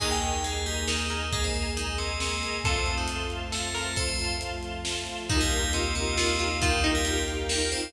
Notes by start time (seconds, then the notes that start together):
0.00 D#2 A#3 D#4 G#4 D#5 G#5 A#5, kick, crash
0.11 G4 G5
0.22 D#5 G#5 A#5, closed hi-hat
0.44 G#3 G#4 D#5 G#5 A#5, closed hi-hat
0.66 G3 G4 D#5 G#5 A#5, closed hi-hat
0.87 D#3 D#4 A#4 D#5 G#5 A#5, snare
1.10 A#4 D#5 G#5 A#5, closed hi-hat
1.32 G#3 A#3 G#4 D#5 G#5 A#5, kick, closed hi-hat
1.44 C4 C5
1.54 D#5 G#5 A#5, closed hi-hat
1.77 D#3 D#4 D#5 G#5 A#5, closed hi-hat
1.98 C3 C4 D#5 G#5 A#5, closed hi-hat
2.20 C3 C4 D#5 G#5 A#5, snare
2.42 D#5 G#5 A#5, closed hi-hat
2.64 F2 C3 A3 C4 F4 A4 F5 A5 C6, kick, closed hi-hat
2.86 F5 A5 C6, closed hi-hat
2.97 D#3 D#4
3.08 F5 A5 C6, closed hi-hat
3.30 F5 A5 C6, closed hi-hat
3.52 A3 A4 F5 A5 C6, snare
3.75 A3 A4 A#4 F5 A5 C6, open hi-hat
3.96 F3 A3 C4 F4 A4 C5 F5 A5 C6, kick, closed hi-hat
4.19 F5 A5 C6, closed hi-hat
4.41 F5 A5 C6, closed hi-hat
4.63 F5 A5 C6, closed hi-hat
4.85 F5 A5 C6, snare
5.07 F5 A5 C6, closed hi-hat
5.29 D#2 D#3 D#4 F4 G4 A#4 D#5 F5, kick, closed hi-hat
5.41 G3 G4
5.51 D#4 F4 G4 A#4, closed hi-hat
5.73 C3 C4 D#4 F4 G4 A#4, closed hi-hat
5.95 C3 C4 D#4 F4 G4 A#4, closed hi-hat
6.17 C3 C4 D#4 F4 G4 A#4, snare
6.39 D#4 F4 G4 A#4, closed hi-hat
6.61 D#3 D#4 F4 G4 A#4 F5 G5, kick, closed hi-hat
6.84 D#4 F4 G4 A#4, closed hi-hat
6.95 G3 G4
7.05 D#4 F4 G4 A#4, closed hi-hat
7.28 D#4 F4 G4 A#4, closed hi-hat
7.49 A#3 D#4 F4 G4 A#4, snare
7.72 C4 D#4 F4 G4 A#4 C5, closed hi-hat